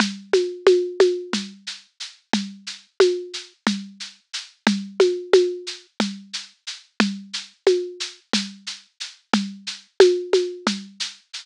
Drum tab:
SH |xxxxxxx|xxxxxxx|xxxxxxx|xxxxxxx|
CG |OoooO--|O-o-O--|Ooo-O--|O-o-O--|

SH |xxxxxxx|
CG |O-ooO--|